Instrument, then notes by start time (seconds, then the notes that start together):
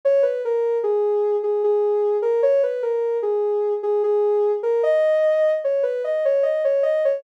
ocarina
0.05 C#5
0.23 B4
0.45 A#4
0.83 G#4
1.43 G#4
1.64 G#4
2.22 A#4
2.43 C#5
2.63 B4
2.83 A#4
3.23 G#4
3.83 G#4
4.04 G#4
4.63 A#4
4.83 D#5
5.64 C#5
5.83 B4
6.04 D#5
6.25 C#5
6.43 D#5
6.64 C#5
6.83 D#5
7.05 C#5